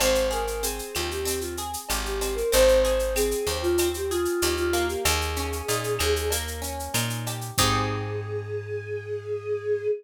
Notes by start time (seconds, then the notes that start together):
0.00 G#1 C4 C5, cowbell, claves, shaker
0.15 shaker
0.31 G#4 A#4, shaker
0.47 shaker
0.62 C4 G#4, shaker
0.79 shaker
0.95 D#2 F4 G4, claves, shaker
1.11 G4, shaker
1.25 C4, cowbell, shaker
1.40 F4, shaker
1.57 G#4, shaker
1.73 shaker
1.89 G#1 G4, cowbell, claves, shaker
2.05 G4, shaker
2.21 C4, cowbell, shaker
2.35 A#4, shaker
2.51 G#1 C4 C5, cowbell, shaker
2.68 shaker
2.83 G#4 C5, shaker
2.99 shaker
3.16 C4 G#4, claves, shaker
3.31 shaker
3.47 D#2 G4 C5, shaker
3.62 F4, shaker
3.78 C4, cowbell, claves, shaker
3.94 G4, shaker
4.10 F4 G#4, shaker
4.25 shaker
4.42 D#2 G4, cowbell, shaker
4.57 F4, shaker
4.73 A#3, cowbell, shaker
4.88 G4, shaker
5.05 D#2 G#4, cowbell, claves, shaker
5.21 shaker
5.36 C#4, shaker
5.53 shaker
5.68 A#2 D#4, shaker
5.84 shaker
5.99 D#2 G#4, claves, shaker
6.16 shaker
6.31 A#3, cowbell, shaker
6.48 shaker
6.62 C#4, shaker
6.79 shaker
6.94 A#2 D#4, cowbell, claves, shaker
7.10 shaker
7.26 G4, cowbell, shaker
7.41 shaker
7.58 G#2 C4 D#4 G4 G#4, kick, crash